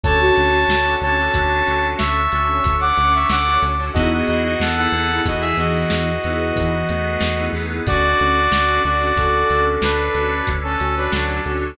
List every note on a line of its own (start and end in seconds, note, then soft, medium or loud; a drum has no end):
0.04 0.31 D2 loud
0.04 1.98 C#4 medium
0.04 0.57 C#4 loud
0.04 1.98 D4 medium
0.04 0.57 D4 loud
0.04 1.98 F#4 medium
0.04 0.57 F#4 loud
0.04 0.19 A4 loud
0.04 1.98 A4 medium
0.04 0.57 A4 loud
0.04 0.94 C#5 medium
0.04 0.94 A5 medium
0.04 kick loud
0.04 closed hi-hat loud
0.21 1.93 F#4 loud
0.37 0.65 D2 medium
0.37 closed hi-hat medium
0.68 0.96 D2 medium
0.68 snare loud
0.85 0.98 C#4 medium
0.85 0.98 D4 medium
0.85 0.98 F#4 medium
0.85 0.98 A4 medium
1.01 1.29 D2 medium
1.01 1.15 C#4 medium
1.01 1.15 D4 loud
1.01 1.15 F#4 medium
1.01 1.15 A4 loud
1.01 1.87 C#5 medium
1.01 1.87 A5 medium
1.01 closed hi-hat medium
1.19 1.32 C#4 loud
1.19 1.32 D4 medium
1.19 1.32 F#4 medium
1.19 1.32 A4 loud
1.34 1.62 D2 medium
1.34 1.61 C#4 medium
1.34 1.61 D4 medium
1.34 1.61 F#4 medium
1.34 1.61 A4 loud
1.34 kick medium
1.34 closed hi-hat loud
1.67 1.95 D2 medium
1.67 2.19 C#4 medium
1.67 2.19 D4 medium
1.67 2.19 F#4 medium
1.67 2.19 A4 loud
1.67 closed hi-hat medium
1.98 2.28 D2 medium
1.98 3.93 C#4 medium
1.98 3.93 D4 medium
1.98 3.93 A4 medium
1.98 3.93 C#5 medium
1.98 2.76 E5 medium
1.98 2.76 C#6 medium
1.98 snare loud
2.32 2.60 D2 medium
2.32 2.85 C#4 loud
2.32 2.85 D4 medium
2.32 2.85 F#4 medium
2.32 2.85 A4 medium
2.32 closed hi-hat medium
2.64 2.92 D2 medium
2.64 kick loud
2.64 closed hi-hat loud
2.81 3.12 F#5 medium
2.81 3.12 D6 medium
2.97 3.25 D2 medium
2.97 closed hi-hat medium
3.15 3.30 E5 medium
3.15 3.30 C#6 medium
3.29 3.58 D2 medium
3.29 3.58 F#5 medium
3.29 3.58 D6 medium
3.29 snare loud
3.47 3.60 C#4 medium
3.47 3.60 D4 medium
3.47 3.60 F#4 medium
3.47 3.60 A4 medium
3.62 3.90 D2 medium
3.62 3.75 C#4 medium
3.62 3.75 D4 loud
3.62 3.75 F#4 medium
3.62 3.75 A4 loud
3.62 closed hi-hat medium
3.79 3.92 C#4 medium
3.79 3.92 D4 medium
3.79 3.92 F#4 medium
3.79 3.92 A4 medium
3.94 4.22 E2 medium
3.94 4.56 B3 medium
3.94 5.89 B3 medium
3.94 4.48 B3 loud
3.94 4.56 D#4 loud
3.94 5.89 D#4 medium
3.94 4.48 D#4 loud
3.94 5.89 E4 medium
3.94 4.48 E4 loud
3.94 4.09 F#4 medium
3.94 5.89 G#4 medium
3.94 4.48 G#4 loud
3.94 4.09 D#5 medium
3.94 kick loud
3.94 closed hi-hat loud
4.13 4.26 F#4 medium
4.13 4.26 D#5 medium
4.27 4.56 E2 medium
4.27 4.43 F#4 medium
4.27 4.43 D#5 medium
4.27 closed hi-hat medium
4.45 4.60 F#4 medium
4.45 4.60 D#5 medium
4.60 4.88 E2 medium
4.60 4.77 B3 loud
4.60 4.76 A4 medium
4.60 4.76 F#5 medium
4.60 snare loud
4.76 4.89 B3 medium
4.76 5.21 B3 loud
4.76 4.89 D#4 loud
4.76 4.89 E4 medium
4.76 4.89 G#4 medium
4.76 5.21 A4 medium
4.76 5.21 F#5 medium
4.92 5.20 E2 medium
4.92 5.06 B3 loud
4.92 5.06 D#4 loud
4.92 5.06 E4 loud
4.92 5.06 G#4 loud
4.92 closed hi-hat medium
5.10 5.23 B3 medium
5.10 5.23 D#4 loud
5.10 5.23 E4 loud
5.10 5.23 G#4 medium
5.24 5.53 E2 medium
5.24 5.55 E3 loud
5.24 5.50 B3 loud
5.24 5.50 D#4 medium
5.24 5.50 E4 loud
5.24 5.42 F#4 medium
5.24 5.50 G#4 medium
5.24 5.42 D#5 medium
5.24 kick medium
5.24 closed hi-hat loud
5.41 5.56 G#4 medium
5.41 5.56 E5 medium
5.57 5.85 E2 medium
5.57 6.12 E3 loud
5.57 6.09 B3 medium
5.57 6.09 D#4 medium
5.57 6.09 E4 medium
5.57 7.45 F#4 medium
5.57 6.09 G#4 loud
5.57 7.45 D#5 medium
5.57 closed hi-hat medium
5.90 6.19 E2 medium
5.90 7.85 B3 medium
5.90 7.85 D#4 medium
5.90 7.85 G#4 medium
5.90 7.85 B4 medium
5.90 snare loud
6.24 6.52 E2 medium
6.24 6.77 B3 loud
6.24 6.77 D#4 medium
6.24 6.77 E4 loud
6.24 6.77 G#4 medium
6.24 closed hi-hat medium
6.56 6.84 E2 medium
6.56 6.87 E3 loud
6.56 kick loud
6.56 closed hi-hat loud
6.89 7.17 E2 medium
6.89 7.77 A3 medium
6.89 closed hi-hat medium
7.21 7.49 E2 medium
7.21 snare loud
7.38 7.51 B3 loud
7.38 7.51 D#4 medium
7.38 7.51 E4 medium
7.38 7.51 G#4 medium
7.53 7.81 E2 medium
7.53 7.67 B3 loud
7.53 7.67 D#4 medium
7.53 7.67 E4 medium
7.53 7.67 G#4 loud
7.53 open hi-hat medium
7.70 7.83 B3 loud
7.70 7.83 D#4 loud
7.70 7.83 E4 medium
7.70 7.83 G#4 loud
7.86 8.15 D2 loud
7.86 9.80 C#4 medium
7.86 8.39 C#4 loud
7.86 9.80 D4 medium
7.86 8.39 D4 loud
7.86 9.80 F#4 medium
7.86 8.81 F#4 medium
7.86 8.39 F#4 loud
7.86 9.80 A4 medium
7.86 8.39 A4 loud
7.86 8.81 D5 medium
7.86 kick loud
7.86 closed hi-hat loud
8.19 8.48 D2 medium
8.19 closed hi-hat medium
8.52 8.79 D2 medium
8.52 snare loud
8.68 8.81 C#4 loud
8.68 8.81 D4 medium
8.68 8.81 F#4 medium
8.68 8.81 A4 loud
8.84 9.12 D2 medium
8.84 8.98 C#4 medium
8.84 8.98 D4 medium
8.84 8.98 F#4 medium
8.84 9.64 F#4 medium
8.84 8.98 A4 medium
8.84 9.64 D5 medium
8.84 closed hi-hat medium
9.00 9.13 C#4 medium
9.00 9.13 D4 loud
9.00 9.13 F#4 medium
9.00 9.13 A4 medium
9.16 9.44 D2 medium
9.16 9.42 C#4 medium
9.16 9.42 D4 medium
9.16 9.42 F#4 loud
9.16 10.30 A4 medium
9.16 9.42 A4 medium
9.16 kick medium
9.16 closed hi-hat loud
9.50 9.78 D2 medium
9.50 10.03 C#4 medium
9.50 10.03 D4 medium
9.50 10.03 F#4 loud
9.50 10.03 A4 medium
9.50 closed hi-hat medium
9.82 10.10 D2 medium
9.82 11.76 C#4 medium
9.82 10.48 D4 medium
9.82 11.76 D4 medium
9.82 11.76 A4 medium
9.82 10.48 B4 medium
9.82 11.76 C#5 medium
9.82 snare loud
10.14 10.42 D2 medium
10.14 10.67 C#4 medium
10.14 10.67 D4 medium
10.14 10.67 F#4 medium
10.14 10.67 A4 medium
10.14 closed hi-hat medium
10.47 10.76 D2 medium
10.47 kick medium
10.47 closed hi-hat loud
10.63 10.95 C#4 medium
10.63 10.95 A4 medium
10.79 11.08 D2 medium
10.79 10.95 F#4 loud
10.79 closed hi-hat medium
10.95 11.11 D4 medium
10.95 11.38 F#4 loud
10.95 11.12 B4 medium
11.11 11.40 D2 medium
11.11 11.41 F#3 medium
11.11 11.41 D4 medium
11.11 snare loud
11.29 11.42 C#4 loud
11.29 11.42 D4 medium
11.29 11.42 F#4 medium
11.29 11.42 A4 loud
11.46 11.74 D2 medium
11.46 11.59 C#4 loud
11.46 11.59 D4 loud
11.46 11.59 F#4 medium
11.46 11.74 F#4 loud
11.46 11.59 A4 loud
11.46 closed hi-hat medium
11.61 11.74 C#4 medium
11.61 11.74 D4 loud
11.61 11.74 F#4 loud
11.61 11.74 A4 medium